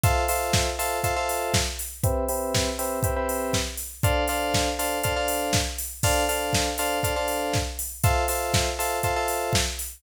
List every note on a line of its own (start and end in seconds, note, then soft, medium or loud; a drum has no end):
0.04 0.24 F4 loud
0.04 0.24 A4 loud
0.04 0.24 C5 loud
0.04 0.24 E5 loud
0.04 kick loud
0.04 closed hi-hat loud
0.28 0.69 F4 medium
0.28 0.69 A4 medium
0.28 0.69 C5 medium
0.28 0.69 E5 medium
0.28 open hi-hat loud
0.53 kick loud
0.53 snare loud
0.79 0.99 F4 medium
0.79 0.99 A4 loud
0.79 0.99 C5 medium
0.79 0.99 E5 loud
0.79 open hi-hat medium
1.04 1.14 F4 loud
1.04 1.14 A4 loud
1.04 1.14 C5 loud
1.04 1.14 E5 medium
1.04 kick medium
1.04 closed hi-hat loud
1.16 1.56 F4 medium
1.16 1.56 A4 loud
1.16 1.56 C5 medium
1.16 1.56 E5 medium
1.29 open hi-hat medium
1.54 kick loud
1.54 snare loud
1.79 open hi-hat medium
2.04 2.24 C4 loud
2.04 2.24 G4 loud
2.04 2.24 B4 loud
2.04 2.24 E5 loud
2.04 kick loud
2.04 closed hi-hat loud
2.29 2.69 C4 medium
2.29 2.69 G4 medium
2.29 2.69 B4 loud
2.29 2.69 E5 medium
2.29 open hi-hat medium
2.54 kick loud
2.54 snare loud
2.79 2.99 C4 loud
2.79 2.99 G4 medium
2.79 2.99 B4 medium
2.79 2.99 E5 medium
2.79 open hi-hat medium
3.03 3.14 C4 medium
3.03 3.14 G4 loud
3.03 3.14 B4 medium
3.03 3.14 E5 medium
3.03 kick loud
3.03 closed hi-hat loud
3.16 3.56 C4 medium
3.16 3.56 G4 loud
3.16 3.56 B4 loud
3.16 3.56 E5 medium
3.29 open hi-hat medium
3.53 kick medium
3.53 snare loud
3.77 open hi-hat medium
4.03 4.24 D4 loud
4.03 4.24 A4 loud
4.03 4.24 C5 loud
4.03 4.24 F5 loud
4.03 kick loud
4.03 closed hi-hat loud
4.28 4.69 D4 loud
4.28 4.69 A4 medium
4.28 4.69 C5 medium
4.28 4.69 F5 loud
4.28 open hi-hat medium
4.54 kick medium
4.54 snare loud
4.79 4.99 D4 medium
4.79 4.99 A4 medium
4.79 4.99 C5 medium
4.79 4.99 F5 medium
4.79 open hi-hat medium
5.04 5.14 D4 medium
5.04 5.14 A4 medium
5.04 5.14 C5 loud
5.04 5.14 F5 loud
5.04 kick medium
5.04 closed hi-hat loud
5.16 5.56 D4 medium
5.16 5.56 A4 medium
5.16 5.56 C5 medium
5.16 5.56 F5 medium
5.28 open hi-hat medium
5.53 kick loud
5.53 snare loud
5.78 open hi-hat medium
6.03 6.24 D4 loud
6.03 6.24 A4 loud
6.03 6.24 C5 loud
6.03 6.24 F5 loud
6.03 kick loud
6.03 crash loud
6.29 6.69 D4 medium
6.29 6.69 A4 medium
6.29 6.69 C5 medium
6.29 6.69 F5 medium
6.29 open hi-hat medium
6.53 kick loud
6.53 snare loud
6.78 6.99 D4 medium
6.78 6.99 A4 loud
6.78 6.99 C5 loud
6.78 6.99 F5 loud
6.78 open hi-hat medium
7.03 7.14 D4 medium
7.03 7.14 A4 loud
7.03 7.14 C5 medium
7.03 7.14 F5 medium
7.03 kick medium
7.03 closed hi-hat loud
7.16 7.56 D4 medium
7.16 7.56 A4 loud
7.16 7.56 C5 medium
7.16 7.56 F5 medium
7.28 open hi-hat medium
7.53 kick loud
7.53 snare loud
7.79 open hi-hat loud
8.04 8.24 F4 loud
8.04 8.24 A4 loud
8.04 8.24 C5 loud
8.04 8.24 E5 loud
8.04 kick loud
8.04 closed hi-hat loud
8.28 8.69 F4 medium
8.28 8.69 A4 medium
8.28 8.69 C5 medium
8.28 8.69 E5 medium
8.28 open hi-hat loud
8.54 kick loud
8.54 snare loud
8.79 8.99 F4 medium
8.79 8.99 A4 loud
8.79 8.99 C5 medium
8.79 8.99 E5 loud
8.79 open hi-hat medium
9.03 9.14 F4 loud
9.03 9.14 A4 loud
9.03 9.14 C5 loud
9.03 9.14 E5 medium
9.03 kick medium
9.03 closed hi-hat loud
9.16 9.56 F4 medium
9.16 9.56 A4 loud
9.16 9.56 C5 medium
9.16 9.56 E5 medium
9.28 open hi-hat medium
9.53 kick loud
9.53 snare loud
9.79 open hi-hat medium